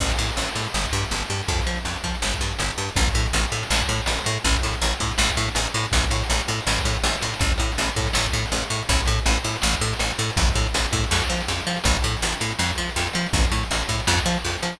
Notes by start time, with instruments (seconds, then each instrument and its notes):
0.00 electric bass (finger) A1, kick, crash
0.09 kick, closed hi-hat
0.18 electric bass (finger) A2, closed hi-hat
0.29 closed hi-hat
0.37 electric bass (finger) A1, closed hi-hat
0.49 closed hi-hat
0.55 electric bass (finger) A2, closed hi-hat
0.66 closed hi-hat
0.74 electric bass (finger) G1, snare
0.85 kick, closed hi-hat
0.93 electric bass (finger) G2, closed hi-hat
1.05 closed hi-hat
1.11 electric bass (finger) G1, closed hi-hat
1.22 snare, closed hi-hat
1.30 electric bass (finger) G2, closed hi-hat
1.43 closed hi-hat
1.48 electric bass (finger) F2, kick, closed hi-hat
1.60 kick, closed hi-hat
1.66 electric bass (finger) F3, closed hi-hat
1.76 closed hi-hat
1.85 electric bass (finger) F2, closed hi-hat
1.96 closed hi-hat
2.04 electric bass (finger) F3, kick, closed hi-hat
2.15 closed hi-hat
2.22 electric bass (finger) G1, snare
2.34 kick, closed hi-hat
2.41 electric bass (finger) G2, closed hi-hat
2.53 closed hi-hat
2.59 electric bass (finger) G1, closed hi-hat
2.70 snare, closed hi-hat
2.78 electric bass (finger) G2, closed hi-hat
2.89 closed hi-hat
2.96 electric bass (finger) A1, kick, closed hi-hat
3.08 kick, closed hi-hat
3.14 electric bass (finger) A2, closed hi-hat
3.26 closed hi-hat
3.33 electric bass (finger) A1, closed hi-hat
3.45 closed hi-hat
3.52 electric bass (finger) A2, closed hi-hat
3.63 closed hi-hat
3.70 electric bass (finger) A1, snare
3.81 kick, closed hi-hat
3.89 electric bass (finger) A2, closed hi-hat
4.01 closed hi-hat
4.06 electric bass (finger) A1, closed hi-hat
4.18 snare, closed hi-hat
4.24 electric bass (finger) A2, closed hi-hat
4.38 closed hi-hat
4.44 electric bass (finger) A1, kick, closed hi-hat
4.55 kick, closed hi-hat
4.63 electric bass (finger) A2, closed hi-hat
4.73 closed hi-hat
4.81 electric bass (finger) A1, closed hi-hat
4.94 closed hi-hat
5.00 electric bass (finger) A2, kick, closed hi-hat
5.11 closed hi-hat
5.18 electric bass (finger) A1, snare
5.29 kick, closed hi-hat
5.37 electric bass (finger) A2, closed hi-hat
5.48 closed hi-hat
5.55 electric bass (finger) A1, closed hi-hat
5.66 snare, closed hi-hat
5.74 electric bass (finger) A2, closed hi-hat
5.83 closed hi-hat
5.92 electric bass (finger) A1, kick, closed hi-hat
6.03 kick, snare, closed hi-hat
6.10 electric bass (finger) A2, closed hi-hat
6.23 closed hi-hat
6.30 electric bass (finger) A1, closed hi-hat
6.39 closed hi-hat
6.48 electric bass (finger) A2, closed hi-hat
6.61 closed hi-hat
6.67 electric bass (finger) A1, snare
6.79 kick, closed hi-hat
6.85 electric bass (finger) A2, closed hi-hat
6.95 closed hi-hat
7.03 electric bass (finger) A1, closed hi-hat
7.15 snare, closed hi-hat
7.21 electric bass (finger) A2, closed hi-hat
7.34 closed hi-hat
7.39 electric bass (finger) A1, kick, closed hi-hat
7.51 kick, closed hi-hat
7.58 electric bass (finger) A2, closed hi-hat
7.72 closed hi-hat
7.78 electric bass (finger) A1, closed hi-hat
7.88 closed hi-hat
7.96 electric bass (finger) A2, kick, closed hi-hat
8.06 closed hi-hat
8.13 electric bass (finger) A1, snare
8.24 kick, closed hi-hat
8.33 electric bass (finger) A2, closed hi-hat
8.46 closed hi-hat
8.52 electric bass (finger) A1, closed hi-hat
8.61 snare, closed hi-hat
8.70 electric bass (finger) A2, closed hi-hat
8.82 closed hi-hat
8.89 electric bass (finger) A1, kick, closed hi-hat
9.00 kick, closed hi-hat
9.06 electric bass (finger) A2, closed hi-hat
9.19 closed hi-hat
9.26 electric bass (finger) A1, closed hi-hat
9.38 closed hi-hat
9.44 electric bass (finger) A2, closed hi-hat
9.55 closed hi-hat
9.62 electric bass (finger) A1, snare
9.73 kick, closed hi-hat
9.81 electric bass (finger) A2, closed hi-hat
9.93 closed hi-hat
9.99 electric bass (finger) A1, closed hi-hat
10.10 snare, closed hi-hat
10.18 electric bass (finger) A2, closed hi-hat
10.30 closed hi-hat
10.37 electric bass (finger) A1, kick, closed hi-hat
10.49 kick, closed hi-hat
10.55 electric bass (finger) A2, closed hi-hat
10.66 closed hi-hat
10.74 electric bass (finger) A1, closed hi-hat
10.86 closed hi-hat
10.92 electric bass (finger) A2, kick, closed hi-hat
11.04 closed hi-hat
11.11 electric bass (finger) F2, snare
11.22 kick, closed hi-hat
11.30 electric bass (finger) F3, closed hi-hat
11.41 closed hi-hat
11.48 electric bass (finger) F2, closed hi-hat
11.60 snare, closed hi-hat
11.67 electric bass (finger) F3, closed hi-hat
11.76 closed hi-hat
11.84 electric bass (finger) A1, kick, closed hi-hat
11.95 kick, closed hi-hat
12.02 electric bass (finger) A2, closed hi-hat
12.16 closed hi-hat
12.22 electric bass (finger) A1, closed hi-hat
12.33 snare, closed hi-hat
12.40 electric bass (finger) A2, closed hi-hat
12.51 closed hi-hat
12.59 electric bass (finger) F2, snare
12.70 kick, closed hi-hat
12.78 electric bass (finger) F3, closed hi-hat
12.89 closed hi-hat
12.96 electric bass (finger) F2, closed hi-hat
13.06 snare, closed hi-hat
13.13 electric bass (finger) F3, closed hi-hat
13.26 closed hi-hat
13.33 electric bass (finger) A1, kick, closed hi-hat
13.44 kick, closed hi-hat
13.52 electric bass (finger) A2, closed hi-hat
13.63 closed hi-hat
13.71 electric bass (finger) A1, closed hi-hat
13.82 closed hi-hat
13.89 electric bass (finger) A2, kick, closed hi-hat
14.00 closed hi-hat
14.07 electric bass (finger) F2, snare
14.17 kick, closed hi-hat
14.26 electric bass (finger) F3, closed hi-hat
14.38 closed hi-hat
14.45 electric bass (finger) F2, closed hi-hat
14.54 snare, closed hi-hat
14.62 electric bass (finger) F3, closed hi-hat
14.73 closed hi-hat